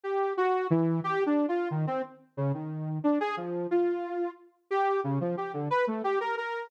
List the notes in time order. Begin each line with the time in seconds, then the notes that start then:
0.03 G4
0.37 F#4
0.70 E3
1.04 G4
1.26 D4
1.48 F4
1.71 D#3
1.87 C4
2.37 C#3
2.54 D#3
3.04 D4
3.20 G#4
3.37 F3
3.71 F4
4.71 G4
5.04 C#3
5.21 F3
5.37 G4
5.53 D3
5.70 B4
5.87 A3
6.04 G4
6.20 A#4
6.37 A#4